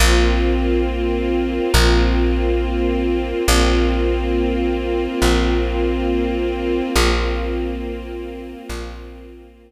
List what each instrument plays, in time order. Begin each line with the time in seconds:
0.00 electric bass (finger) A#1, string ensemble 1 A#3 C4 F4
1.74 electric bass (finger) A#1
3.47 electric bass (finger) A#1, string ensemble 1 A#3 C4 F4
5.22 electric bass (finger) A#1
6.95 electric bass (finger) A#1, string ensemble 1 A#3 C4 F4
8.69 electric bass (finger) A#1